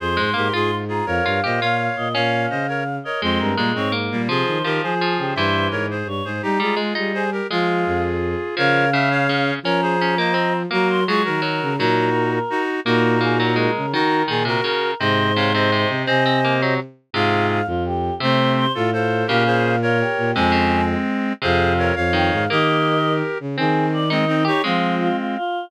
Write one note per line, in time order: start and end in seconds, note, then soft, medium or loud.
0.00 0.17 F2 medium
0.00 0.30 G#4 medium
0.00 0.30 C5 medium
0.00 0.75 C6 medium
0.17 0.34 G#2 medium
0.17 0.33 G#3 medium
0.34 0.50 G#2 medium
0.34 0.48 A#3 medium
0.34 0.53 G4 medium
0.34 0.53 A#4 medium
0.53 1.01 G#2 medium
0.53 0.84 F4 medium
0.53 0.71 F4 medium
0.53 0.71 G#4 medium
0.88 1.06 F4 medium
0.88 1.06 G#4 medium
0.88 1.06 A#5 medium
1.06 1.21 F2 medium
1.06 1.40 A#4 medium
1.06 1.40 C#5 medium
1.06 1.86 F5 medium
1.25 1.41 G2 medium
1.25 1.41 F4 medium
1.44 1.60 A#2 medium
1.44 1.60 G4 medium
1.44 1.60 C5 medium
1.44 1.60 D#5 medium
1.60 1.89 A#2 medium
1.60 1.96 F4 medium
1.60 2.08 C#5 medium
1.60 2.08 F5 medium
1.97 2.14 A#2 medium
1.97 2.13 D#5 medium
2.14 2.47 A#2 medium
2.14 2.66 C#4 medium
2.14 2.46 C#5 medium
2.14 2.46 F5 loud
2.14 2.96 F5 medium
2.50 2.99 C#3 medium
2.50 2.67 C5 medium
2.50 2.67 D#5 medium
2.68 2.83 A#4 medium
2.68 2.83 C#5 medium
3.04 3.22 A#4 medium
3.04 3.22 C#5 medium
3.04 3.19 D#5 medium
3.21 3.38 F2 medium
3.21 3.52 G#3 medium
3.21 3.55 G#3 medium
3.21 3.55 C4 loud
3.21 3.38 C5 medium
3.39 3.55 G2 medium
3.39 3.69 A#4 medium
3.57 3.74 A#2 medium
3.57 3.72 G3 medium
3.57 3.89 G#3 medium
3.57 3.72 A#3 medium
3.75 4.09 G#2 medium
3.75 3.92 G#3 medium
3.75 3.92 C4 medium
3.75 3.92 C#5 medium
3.92 4.22 A#3 medium
4.11 4.27 A#2 medium
4.11 4.28 G3 medium
4.11 4.28 A#3 medium
4.27 4.43 C3 medium
4.27 4.63 F3 medium
4.27 4.58 F4 medium
4.27 4.58 G#4 loud
4.27 4.71 C5 medium
4.47 4.63 D#3 medium
4.63 4.79 D#3 medium
4.63 4.94 F3 medium
4.63 4.82 G4 medium
4.63 4.82 A#4 loud
4.82 5.18 F3 medium
4.82 5.16 G#4 medium
4.82 5.33 G#4 medium
4.82 5.33 C5 medium
5.01 5.35 F3 medium
5.18 5.33 C#3 medium
5.18 5.33 G4 medium
5.35 5.68 G2 medium
5.35 5.97 E3 medium
5.35 5.67 C5 medium
5.35 5.68 C5 medium
5.35 5.67 E5 medium
5.71 6.03 G#2 medium
5.71 5.86 A#4 medium
5.71 5.86 C#5 medium
5.91 6.08 G#4 medium
5.91 6.08 C5 medium
6.06 6.21 G2 medium
6.06 6.24 C#5 medium
6.25 6.40 G#2 medium
6.25 6.42 G#4 medium
6.25 6.42 C5 medium
6.42 6.58 G3 medium
6.42 6.59 D#4 medium
6.42 6.59 G4 loud
6.42 6.77 A#5 medium
6.59 6.75 G3 medium
6.59 6.74 G#3 medium
6.59 7.12 F4 medium
6.59 7.12 G#4 medium
6.76 6.93 G#3 medium
6.95 7.41 G3 medium
6.95 7.24 D#4 medium
7.14 7.30 G#4 medium
7.14 7.30 C5 medium
7.14 7.30 G#5 medium
7.32 7.47 G4 medium
7.32 7.47 A#4 medium
7.50 7.84 F3 medium
7.50 8.17 G#3 medium
7.50 8.55 F4 medium
7.50 8.55 G#4 medium
7.50 8.02 F5 medium
7.86 8.35 F2 medium
8.57 9.52 C#3 medium
8.57 8.85 F3 loud
8.57 8.90 A#4 loud
8.57 8.90 C#5 loud
8.57 9.49 F5 loud
8.93 9.27 C#3 medium
8.93 9.09 E5 loud
9.10 9.54 C#5 medium
9.10 9.54 F5 loud
9.29 9.59 C#3 medium
9.63 10.66 F3 medium
9.63 9.96 C#4 loud
9.63 9.81 A#4 medium
9.63 9.81 C#5 loud
9.63 10.56 A#5 loud
9.82 10.15 G#4 medium
9.82 10.15 C5 loud
10.01 10.18 C#4 medium
10.18 10.35 A#3 medium
10.18 10.53 C5 medium
10.18 10.53 D#5 medium
10.34 10.63 C4 medium
10.71 11.05 F#3 medium
10.71 11.00 A#3 medium
10.71 11.04 F#4 medium
10.71 11.04 A#4 loud
10.71 10.88 A#5 loud
10.89 11.04 C6 medium
11.07 11.40 F#3 medium
11.07 11.22 G#3 medium
11.07 11.22 F4 medium
11.07 11.22 G#4 loud
11.07 11.22 C#6 loud
11.25 11.60 D#3 medium
11.25 11.74 F#4 medium
11.25 11.74 A#4 medium
11.25 11.76 A#5 medium
11.42 11.76 F#3 medium
11.62 11.78 C#3 medium
11.78 12.39 A#2 medium
11.78 12.10 F#3 loud
11.78 12.39 D#4 loud
11.78 12.39 F#4 loud
11.78 12.30 A#4 loud
12.32 12.61 A#4 medium
12.50 12.80 D#4 loud
12.50 12.80 F#4 loud
12.85 13.68 A#2 loud
12.85 13.17 A#3 loud
12.85 13.71 D#4 loud
12.85 13.71 F#4 loud
12.85 13.19 A#4 loud
13.21 13.38 A#3 medium
13.21 13.38 G#4 medium
13.39 13.57 F#3 medium
13.39 13.54 A#4 medium
13.56 13.86 G#3 medium
13.56 13.91 A#4 medium
13.76 13.93 C#3 medium
13.93 14.23 D#3 medium
13.93 14.27 D#3 loud
13.93 14.22 D#4 loud
13.93 14.22 F#4 loud
13.93 14.24 A#4 loud
14.28 14.58 A#2 medium
14.28 14.43 D#3 medium
14.28 14.44 F4 medium
14.28 14.45 G#4 medium
14.28 14.44 G#4 medium
14.45 14.61 C3 medium
14.45 14.91 F#4 medium
14.45 14.61 A#4 medium
14.45 14.91 A#4 loud
14.64 14.94 C#3 medium
14.64 14.94 A#4 medium
15.00 15.85 G#2 loud
15.00 15.32 C3 medium
15.00 15.33 C5 medium
15.00 15.88 C5 loud
15.00 15.33 D#5 loud
15.36 15.53 C3 medium
15.36 15.53 C#5 medium
15.36 15.53 F5 medium
15.54 15.71 C3 medium
15.54 16.03 C5 medium
15.54 16.03 D#5 medium
15.72 16.06 C3 medium
15.88 16.04 C3 medium
16.06 16.77 C3 loud
16.06 16.24 C4 loud
16.06 16.74 C5 medium
16.06 16.74 D#5 loud
16.06 16.54 G#5 loud
16.26 16.40 C4 loud
16.45 16.62 A#3 medium
16.62 16.80 F#3 medium
17.13 17.61 G#2 medium
17.13 17.60 C3 loud
17.13 17.61 F4 loud
17.13 17.61 G#4 loud
17.13 17.47 F5 loud
17.50 17.66 F5 medium
17.66 18.10 F2 medium
17.66 17.83 F4 medium
17.86 18.14 G4 medium
18.20 18.65 C3 loud
18.20 18.68 C3 medium
18.20 18.66 A3 loud
18.20 18.66 C4 loud
18.20 18.52 C5 loud
18.57 18.72 C5 loud
18.75 19.24 A2 medium
18.75 18.90 F4 medium
18.75 18.91 F4 medium
18.75 18.90 A4 loud
18.93 19.23 F4 medium
18.93 19.27 A4 medium
18.93 19.27 C5 medium
19.27 20.03 A#2 loud
19.27 19.77 C#3 medium
19.27 19.44 G4 medium
19.27 19.44 A#4 loud
19.27 19.63 F5 loud
19.46 19.75 G#4 medium
19.46 19.75 C5 loud
19.64 19.79 F5 medium
19.82 19.98 F4 medium
19.82 20.31 A#4 loud
19.82 20.31 C#5 loud
20.00 20.33 G4 medium
20.18 20.33 A#2 medium
20.35 20.95 F2 medium
20.35 20.52 C3 medium
20.35 21.33 G#3 loud
20.35 21.33 C4 loud
20.35 20.84 G#5 loud
20.52 20.81 C#3 medium
21.42 21.91 F2 loud
21.42 21.94 C3 loud
21.42 21.73 G#4 loud
21.42 21.73 C5 loud
21.42 21.88 F5 loud
21.79 21.95 A#4 medium
21.79 21.95 C#5 loud
21.96 22.30 F2 loud
21.96 22.44 C#5 loud
21.96 22.44 F5 loud
22.13 22.46 D#3 medium
22.13 22.28 G5 loud
22.32 22.47 G#2 medium
22.32 22.47 F5 loud
22.50 23.22 D#3 medium
22.50 22.98 A#3 loud
22.50 23.38 G4 medium
22.50 23.38 A#4 loud
22.50 23.12 D#5 loud
23.40 23.56 C#3 medium
23.57 24.49 D#3 loud
23.57 24.04 C4 loud
23.57 23.86 G#4 loud
23.93 24.09 D5 medium
24.10 24.25 G#3 loud
24.10 24.25 C4 loud
24.10 24.42 D#4 medium
24.10 24.43 D#5 medium
24.28 24.44 C4 medium
24.28 24.44 D#4 loud
24.45 24.62 D#4 loud
24.45 24.62 G4 medium
24.45 24.62 G4 loud
24.45 24.62 C#5 medium
24.64 25.08 F3 medium
24.64 25.37 G#3 medium
24.64 25.09 G#3 loud
24.64 25.37 C4 loud
24.64 24.95 F4 loud
25.00 25.16 F4 loud
25.18 25.35 F4 medium
25.36 25.65 F4 loud